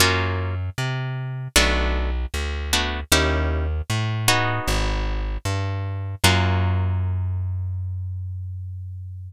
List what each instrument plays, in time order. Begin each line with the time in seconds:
0.00 electric bass (finger) F#2, acoustic guitar (steel) A#3 C#4 F4 F#4
0.78 electric bass (finger) C3
1.56 electric bass (finger) B1, acoustic guitar (steel) A3 B3 D4 F#4
2.34 electric bass (finger) D2
2.73 acoustic guitar (steel) A3 B3 D4 F#4
3.12 electric bass (finger) D#2, acoustic guitar (steel) C#4 D#4 E4 G4
3.90 electric bass (finger) A2
4.28 acoustic guitar (steel) B3 D#4 F#4 G#4
4.68 electric bass (finger) G#1
5.45 electric bass (finger) G2
6.24 electric bass (finger) F#2, acoustic guitar (steel) A#3 C#4 F4 F#4